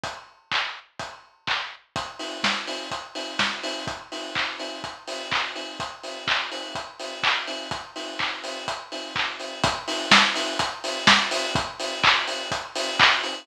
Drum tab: HH |x---x---|xo-oxo-o|xo-oxo-o|xo-oxo-o|
CP |--x---x-|--------|--x---x-|--x---x-|
SD |--------|--o---o-|--------|--------|
BD |o-o-o-o-|o-o-o-o-|o-o-o-o-|o-o-o-o-|

HH |xo-oxo-o|xo-oxo-o|xo-oxo-o|
CP |--x---x-|--------|--x---x-|
SD |--------|--o---o-|--------|
BD |o-o-o-o-|o-o-o-o-|o-o-o-o-|